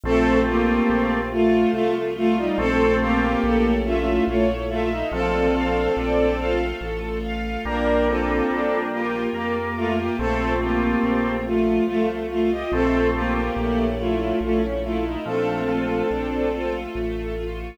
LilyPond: <<
  \new Staff \with { instrumentName = "Violin" } { \time 3/4 \key bes \major \tempo 4 = 71 <c' a'>8 <bes g'>4 <a f'>8 <a f'>16 r16 <a f'>16 <g ees'>16 | <c' a'>8 <bes g'>4 <a f'>8 <a f'>16 r16 <a f'>16 ees'16 | <c' a'>2 r4 | <d' bes'>8 <c' a'>4 <bes g'>8 <bes g'>16 r16 <a f'>16 <bes g'>16 |
<c' a'>8 <bes g'>4 <a f'>8 <a f'>16 r16 <a f'>16 <g' ees''>16 | <c' a'>8 <bes g'>4 <a f'>8 <a f'>16 r16 <a f'>16 ees'16 | <c' a'>2 r4 | }
  \new Staff \with { instrumentName = "Drawbar Organ" } { \time 3/4 \key bes \major <a c'>4. r4. | <a c'>4 r2 | f8 f8 r2 | <g bes>2 bes8. r16 |
<a c'>4. r4. | <a c'>4 r2 | f8 f8 r2 | }
  \new Staff \with { instrumentName = "String Ensemble 1" } { \time 3/4 \key bes \major a8 f'8 c'8 f'8 a8 f'8 | a'8 f''8 a'8 e''8 cis''8 e''8 | a'8 f''8 d''8 f''8 a'8 f''8 | bes8 f'8 d'8 f'8 bes8 f'8 |
a8 f'8 c'8 f'8 a8 f'8 | a8 f'8 a8 e'8 cis'8 e'8 | a8 f'8 d'8 f'8 a8 f'8 | }
  \new Staff \with { instrumentName = "Acoustic Grand Piano" } { \clef bass \time 3/4 \key bes \major bes,,4 bes,,4 c,4 | bes,,4 bes,,4 bes,,4 | bes,,4 bes,,4 a,,4 | bes,,4 bes,,4 f,4 |
bes,,4 bes,,4 c,4 | bes,,4 bes,,4 bes,,4 | bes,,4 bes,,4 a,,4 | }
  \new Staff \with { instrumentName = "String Ensemble 1" } { \time 3/4 \key bes \major <a c' f'>4. <f a f'>4. | <a c' f'>4 <a cis' e'>4 <a e' a'>4 | <a d' f'>4. <a f' a'>4. | <bes d' f'>4. <bes f' bes'>4. |
<a c' f'>4. <f a f'>4. | <a c' f'>4 <a cis' e'>4 <a e' a'>4 | <a d' f'>4. <a f' a'>4. | }
>>